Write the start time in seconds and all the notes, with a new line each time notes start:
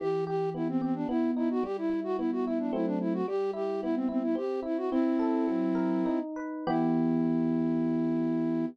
0.00 E3 G4
0.27 G4
0.54 B3 E4
0.69 C4
0.82 C4 G4
0.95 D4
1.09 B3 E4
1.36 D#4 E4
1.51 F#4
1.63 G3 G4
1.78 E4
1.90 E4
2.04 F#4
2.18 B3 E4
2.32 F#4
2.46 E4
2.59 D4
2.73 F#3 A3 C4 E4
2.86 D4
3.00 E4
3.13 F#4
3.28 G3 G4
3.53 E4 G4
3.82 B3 E4
3.95 C4
4.09 C4 E4
4.23 E4
4.35 C4 G4
4.63 E4
4.77 F#4
4.91 C4 E4
5.19 A4
5.47 F#3
5.75 A#4
6.06 D#4
6.36 B4
6.67 E3 B3 E4 G4